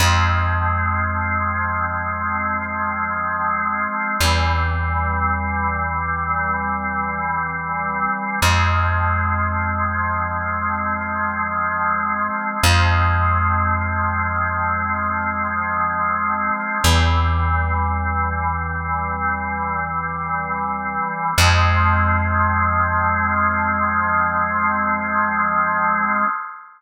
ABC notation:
X:1
M:4/4
L:1/8
Q:1/4=57
K:Fm
V:1 name="Drawbar Organ"
[F,A,C]8 | [=E,G,C]8 | [F,A,C]8 | [F,A,C]8 |
"^rit." [=E,G,C]8 | [F,A,C]8 |]
V:2 name="Electric Bass (finger)" clef=bass
F,,8 | =E,,8 | F,,8 | F,,8 |
"^rit." =E,,8 | F,,8 |]